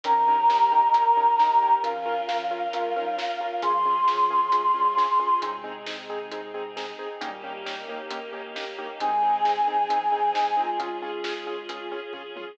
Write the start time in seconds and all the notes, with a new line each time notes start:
0.03 G#1 F3 C#4 D#4 G4 A#4 A#5, kick, closed hi-hat
0.28 C#4 D#4 G4 A#4
0.50 C#4 D#4 G4 A#4, snare
0.72 C#4 D#4 G4 A#4
0.94 C#4 D#4 G4 A#4, closed hi-hat
1.17 C#4 D#4 G4 A#4
1.39 C#4 D#4 G4 A#4, snare
1.62 C#4 D#4 G4 A#4
1.82 G#1 F3 C#4 F4 A#4 F5, kick, closed hi-hat
2.06 C#4 F4 A#4
2.29 F3 C#4 F4 A#4, snare
2.51 C#4 F4 A#4
2.73 G#3 C#4 F4 A#4, closed hi-hat
2.96 G3 C#4 D#4 F4 A#4
3.18 C#4 F4 A#4, snare
3.41 C#4 F4 A#4
3.62 G#1 G#2 F3 C#4 F4 G#4 C6, kick, closed hi-hat
3.85 C#4 F4 G#4
4.08 G#2 F3 C#4 F4 G#4, snare
4.30 C#4 F4 G#4
4.52 C3 G#3 C#4 F4 G#4, closed hi-hat
4.74 A#2 G3 C#4 F4 G#4
4.97 C#4 F4 G#4, snare
5.20 C#4 F4 G#4
5.41 G#1 C3 G#3 C4 D#4 G#4, kick, closed hi-hat
5.64 C4 D#4 G#4
5.86 C4 D#4 G#4, snare
6.10 C4 D#4 G#4
6.31 C4 D#4 G#4, closed hi-hat
6.54 C4 D#4 G#4
6.77 C4 D#4 G#4, snare
6.99 C4 D#4 G#4
7.21 G#1 A#2 G3 A#3 C#4 D#4 G4, kick, closed hi-hat
7.44 A#3 C#4 D#4 G4
7.65 A#3 C#4 D#4 G4, snare
7.89 A#3 C#4 D#4 G4
8.11 A#3 C#4 D#4 G4, closed hi-hat
8.33 A#3 C#4 D#4 G4
8.56 A#3 C#4 D#4 G4, snare
8.78 A#3 C#4 D#4 G4
9.00 G#1 C3 G#3 C4 D#4 G#4 G#5, kick, closed hi-hat
9.23 C4 D#4 G#4
9.45 C4 D#4 G#4, snare
9.67 G#2 F3 C4 D#4 G#4
9.90 G#2 F3 C4 D#4 G#4, closed hi-hat
10.11 G#2 F3 C4 D#4 G#4
10.34 C3 G#3 C4 D#4 G#4, snare
10.57 G#3 C4 D#4 F4 G#4
10.79 G#1 G#3 C#4 F4 G#4, kick, closed hi-hat
11.02 C#4 F4 G#4
11.24 C#4 F4 G#4, snare
11.47 C#4 F4 G#4
11.69 C#4 F4 G#4, closed hi-hat
11.92 C#4 F4 G#4
12.13 A#1 C#4 F4 G#4, kick, floor tom
12.36 A1 C#4 F4 G#4, high tom